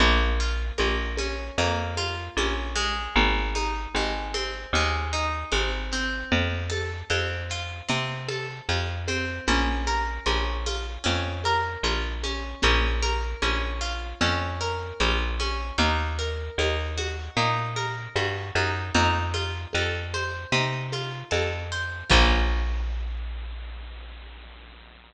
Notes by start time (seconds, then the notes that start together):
0.00 A#1 A#3, low conga, shaker
0.40 F4, shaker
0.78 A#1 A#3, high conga, shaker
1.17 C#4, high conga, shaker
1.58 F2 A#3, low conga, shaker
1.97 F4, high conga, shaker
2.37 A#1 C#4, high conga, shaker
2.75 G#3, high conga, shaker
3.15 G#1, low conga, shaker
3.55 D#4, high conga, shaker
3.95 G#1 G#3, high conga, shaker
4.34 C4, high conga, shaker
4.73 D#2 G#3, low conga, shaker
5.13 D#4, shaker
5.52 G#1 C4, high conga, shaker
5.91 C4, shaker
6.32 F2, low conga, shaker
6.70 A4, high conga, shaker
7.10 F2 C4, high conga, shaker
7.49 F4, shaker
7.88 C3 C4, low conga, shaker
8.28 A4, high conga, shaker
8.69 F2 F4, high conga, shaker
9.08 C4, high conga, shaker
9.47 A#1 C#4, low conga, shaker
9.86 A#4, high conga, shaker
10.26 A#1 C#4, high conga, shaker
10.65 F4, high conga, shaker
11.04 F2 C#4, low conga, shaker
11.44 A#4, high conga, shaker
11.83 A#1 F4, high conga, shaker
12.23 C#4, high conga, shaker
12.62 A#1 C#4, low conga, shaker
13.02 A#4, high conga, shaker
13.42 A#1 C#4, high conga, shaker
13.81 F4, shaker
14.21 F2 C#4, low conga, shaker
14.60 A#4, shaker
15.00 A#1 F4, high conga, shaker
15.39 C#4, high conga, shaker
15.78 D#2 D#4, low conga, shaker
16.19 A#4, shaker
16.58 D#2 D#4, high conga, shaker
16.98 F#4, high conga, shaker
17.36 A#2 D#4, low conga, shaker
17.76 A#4, high conga, shaker
18.15 G2 F#4, high conga, shaker
18.55 F#2 D#4, high conga, shaker
18.95 F2 D#4, low conga, shaker
19.34 F4, high conga, shaker
19.73 F2 A4, high conga, shaker
20.14 C5, high conga, shaker
20.52 C3 D#4, low conga, shaker
20.92 F4, high conga, shaker
21.31 F2 A4, high conga, shaker
21.72 C5, shaker
22.10 A#1 A#3 C#4 F4, kick, crash